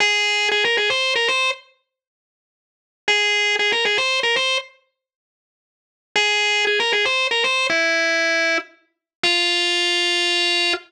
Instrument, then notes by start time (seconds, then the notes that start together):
drawbar organ
0.00 G#4
0.51 G#4
0.64 A#4
0.77 G#4
0.90 C5
1.15 A#4
1.28 C5
3.08 G#4
3.59 G#4
3.72 A#4
3.85 G#4
3.97 C5
4.23 A#4
4.36 C5
6.15 G#4
6.67 G#4
6.79 A#4
6.92 G#4
7.05 C5
7.31 A#4
7.44 C5
7.69 E4
9.23 F4